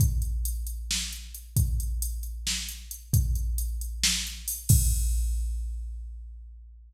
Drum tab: CC |-------|-------|-------|x------|
HH |xxxx-xx|xxxx-xx|xxxx-xo|-------|
SD |----o--|----o--|----o--|-------|
BD |o------|o------|o------|o------|